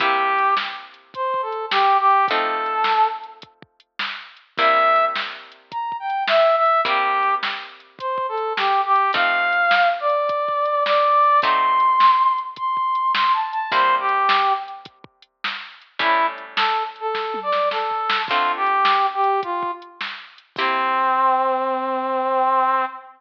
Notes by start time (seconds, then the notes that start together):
0.00 C3 A#3 E4 G4, kick, closed hi-hat
0.38 closed hi-hat
0.57 snare
0.94 closed hi-hat
1.14 C5, kick, closed hi-hat
1.34 kick
1.42 A4
1.52 closed hi-hat
1.71 G4, snare
2.00 G4
2.11 closed hi-hat
2.28 F3 A3 C4 D#4 A4, kick, closed hi-hat
2.66 closed hi-hat
2.84 snare
3.24 closed hi-hat
3.42 kick, closed hi-hat
3.62 kick
3.80 closed hi-hat
3.99 snare
4.37 closed hi-hat
4.58 C3 G3 A#3 E4 E5, kick, closed hi-hat
4.96 closed hi-hat
5.16 snare
5.52 closed hi-hat
5.71 A#5, kick, closed hi-hat
5.92 kick
6.00 G5
6.10 closed hi-hat
6.28 E5, snare
6.57 E5
6.66 closed hi-hat
6.85 C3 G3 A#3 E4 G4, kick, closed hi-hat
7.23 closed hi-hat
7.43 snare
7.80 closed hi-hat
7.99 C5, kick, closed hi-hat
8.18 kick
8.29 A4
8.38 closed hi-hat
8.57 G4, snare
8.86 G4
8.96 closed hi-hat
9.13 F3 A3 C4 D#4 F5, kick, closed hi-hat
9.53 closed hi-hat
9.71 snare
10.00 D5
10.10 closed hi-hat
10.29 kick, closed hi-hat
10.48 kick
10.65 closed hi-hat
10.85 D5, snare
11.24 closed hi-hat
11.42 F#3 A3 C4 D#4 C6, kick, closed hi-hat
11.80 closed hi-hat
12.00 snare
12.38 closed hi-hat
12.56 C6, kick, closed hi-hat
12.77 kick
12.95 closed hi-hat
13.15 C6, snare
13.34 A5
13.53 A5, closed hi-hat
13.71 C3 G3 A#3 E4 C5, kick, closed hi-hat
14.00 G4
14.09 closed hi-hat
14.29 snare
14.68 closed hi-hat
14.85 kick, closed hi-hat
15.04 kick
15.22 closed hi-hat
15.44 snare
15.82 closed hi-hat
15.99 A2 G3 C#4 E4, kick, closed hi-hat
16.38 closed hi-hat
16.57 A4, snare
16.96 closed hi-hat
17.00 A4
17.15 kick, snare
17.34 high tom
17.43 D5
17.52 snare
17.71 A4, snare
17.91 floor tom
18.10 snare
18.28 D3 A3 C4 F4, kick, crash
18.57 G4
18.67 closed hi-hat
18.85 snare
19.15 G4
19.24 closed hi-hat
19.43 F4, kick, closed hi-hat
19.63 kick
19.82 closed hi-hat
20.01 snare
20.38 closed hi-hat
20.56 C3 A#3 C4 E4 G4, kick, crash